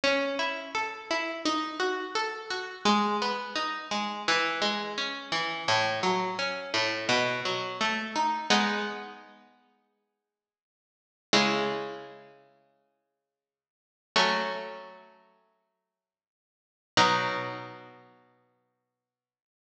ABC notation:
X:1
M:4/4
L:1/8
Q:1/4=85
K:E
V:1 name="Harpsichord"
C E A E D F A F | G, B, D G, E, G, C E, | A,, F, C A,, B,, F, A, D | [G,B,D]8 |
[C,G,E]8 | [F,A,C]8 | [B,,F,D]8 |]